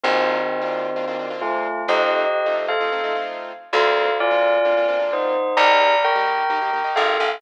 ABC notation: X:1
M:4/4
L:1/16
Q:1/4=130
K:Bb
V:1 name="Tubular Bells"
[E,C]12 [A,F]4 | [Ge]6 z [Af]5 z4 | [Af]4 [Fd]8 [Ec]4 | [db]4 [Bg]8 [Af]4 |]
V:2 name="Acoustic Grand Piano"
[B,CDF]5 [B,CDF]3 [B,CDF] [B,CDF] [B,CDF] [B,CDF]5 | [A,CEF]5 [A,CEF]3 [A,CEF] [A,CEF] [A,CEF] [A,CEF]5 | [B,CDF]5 [B,CDF]3 [B,CDF] [B,CDF] [B,CDF] [B,CDF]5 | [B,EG]5 [B,EG]3 [B,EG] [B,EG] [B,EG] [B,EG]5 |]
V:3 name="Electric Bass (finger)" clef=bass
B,,,16 | F,,16 | D,,16 | B,,,12 _A,,,2 =A,,,2 |]